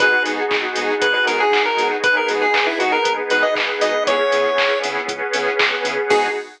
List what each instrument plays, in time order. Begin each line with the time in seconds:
0.00 synth bass 1 G#1, lead 2 (sawtooth) B3 D#4 F#4 G#4, pad 5 (bowed) B3 D#4 F#4 G#4, lead 1 (square) B4, kick, closed hi-hat
0.25 synth bass 1 G#2, lead 2 (sawtooth) B3 D#4 F#4 G#4, open hi-hat
0.51 synth bass 1 G#1, kick, clap
0.76 synth bass 1 G#2, lead 2 (sawtooth) B3 D#4 F#4 G#4, open hi-hat
1.02 synth bass 1 G#1, lead 1 (square) B4, kick, closed hi-hat
1.14 lead 1 (square) B4
1.26 synth bass 1 G#2, lead 2 (sawtooth) B3 D#4 F#4 G#4, lead 1 (square) A#4, open hi-hat
1.40 lead 1 (square) G#4
1.52 synth bass 1 G#1, kick, clap
1.65 lead 1 (square) A#4
1.77 synth bass 1 G#2, lead 2 (sawtooth) B3 D#4 F#4 G#4, open hi-hat
2.03 synth bass 1 G#1, pad 5 (bowed) B3 D#4 G#4 B4, lead 1 (square) B4, kick, closed hi-hat
2.17 lead 1 (square) A#4
2.28 synth bass 1 G#2, lead 2 (sawtooth) B3 D#4 F#4 G#4, open hi-hat
2.42 lead 1 (square) G#4
2.54 synth bass 1 G#1, kick, clap
2.67 lead 1 (square) E4
2.79 synth bass 1 G#2, lead 2 (sawtooth) B3 D#4 F#4 G#4, lead 1 (square) F#4, open hi-hat
2.92 lead 1 (square) A#4
3.05 synth bass 1 G#1, kick, closed hi-hat
3.30 synth bass 1 G#2, lead 2 (sawtooth) B3 D#4 F#4 G#4, lead 1 (square) B4, open hi-hat
3.42 lead 1 (square) D#5
3.56 synth bass 1 G#1, kick, clap
3.81 synth bass 1 G#2, lead 2 (sawtooth) B3 D#4 F#4 G#4, lead 1 (square) D#5, open hi-hat
4.06 synth bass 1 C#2, pad 5 (bowed) B3 C#4 E4 G#4, lead 2 (sawtooth) B3 C#4 E4 G#4, lead 1 (square) C#5, kick, closed hi-hat
4.32 synth bass 1 C#3, lead 2 (sawtooth) B3 C#4 E4 G#4, open hi-hat
4.58 synth bass 1 C#2, kick, clap
4.83 synth bass 1 C#3, lead 2 (sawtooth) B3 C#4 E4 G#4, open hi-hat
5.08 synth bass 1 C#2, pad 5 (bowed) B3 C#4 G#4 B4, kick, closed hi-hat
5.33 synth bass 1 C#3, lead 2 (sawtooth) B3 C#4 E4 G#4, open hi-hat
5.59 synth bass 1 C#2, kick, clap
5.85 synth bass 1 C#3, lead 2 (sawtooth) B3 C#4 E4 G#4, open hi-hat
6.09 synth bass 1 G#2, lead 2 (sawtooth) B3 D#4 F#4 G#4, pad 5 (bowed) B3 D#4 F#4 G#4, lead 1 (square) G#4, kick, crash